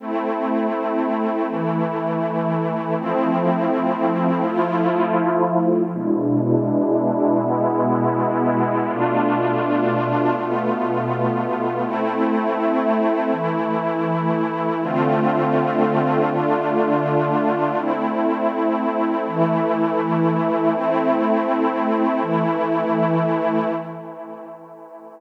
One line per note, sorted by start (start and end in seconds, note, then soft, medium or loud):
0.00 1.46 A3 medium
0.00 1.46 C4 medium
0.00 1.46 E4 medium
1.48 2.95 E3 medium
1.48 2.95 A3 medium
1.48 2.95 E4 medium
2.96 4.43 F3 medium
2.96 4.43 A3 medium
2.96 4.43 C4 medium
2.96 4.43 E4 medium
4.44 5.91 F3 medium
4.44 5.91 A3 medium
4.44 5.91 E4 medium
4.44 5.91 F4 medium
5.93 7.40 B2 medium
5.93 7.40 G#3 medium
5.93 7.40 D4 medium
5.93 7.40 E4 medium
7.40 8.87 B2 medium
7.40 8.87 G#3 medium
7.40 8.87 B3 medium
7.40 8.87 E4 medium
8.88 10.35 B2 medium
8.88 10.35 A3 medium
8.88 10.35 D4 medium
8.88 10.35 F4 medium
10.38 11.85 B2 medium
10.38 11.83 A3 medium
10.38 11.85 B3 medium
10.38 11.85 F4 medium
11.84 13.31 A3 loud
11.84 13.31 C4 medium
11.84 13.31 E4 medium
13.32 14.79 E3 medium
13.32 14.79 A3 medium
13.32 14.79 E4 medium
14.82 16.29 D3 medium
14.82 16.29 A3 loud
14.82 16.29 C4 medium
14.82 16.29 F4 medium
16.30 17.77 D3 medium
16.30 17.76 A3 medium
16.30 17.77 D4 medium
16.30 17.77 F4 medium
17.77 19.24 A3 medium
17.77 19.24 C4 medium
17.77 19.24 E4 medium
19.27 20.73 E3 medium
19.27 20.73 A3 medium
19.27 20.73 E4 medium
20.73 22.20 A3 medium
20.73 22.20 C4 medium
20.73 22.20 E4 medium
22.22 23.68 E3 medium
22.22 23.68 A3 medium
22.22 23.68 E4 medium